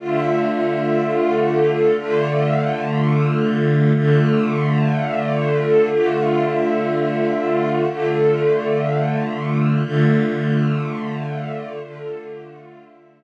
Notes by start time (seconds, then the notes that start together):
0.00 D3 A3 F4
1.97 D3 A3 F4
3.94 D3 A3 F4
5.90 D3 A3 F4
7.87 D3 A3 F4
9.84 D3 A3 F4
11.80 D3 A3 F4